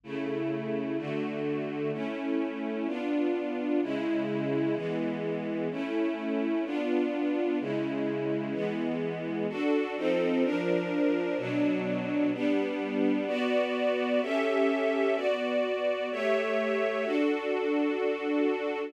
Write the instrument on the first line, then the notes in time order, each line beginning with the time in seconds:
string ensemble 1
0.03 C#3 A3 E4
0.98 D3 A3 F#4
1.93 A3 C#4 E4
2.87 B3 D4 F4
3.82 C#3 G#3 E4
4.75 E3 G#3 B3
5.71 A3 C#4 E4
6.65 B3 D4 F4
7.60 C#3 G#3 E4
8.53 E3 G#3 B3
9.49 D4 F#4 A4
9.96 F3 C4 D#4 A4
10.44 F3 D4 A#4
11.38 B2 F#3 D4
12.33 G3 B3 D4
13.27 B3 F#4 D5
14.22 C#4 G4 A4 E5
15.15 B3 F#4 D5
16.11 A3 G4 C#5 E5
17.04 D4 F#4 A4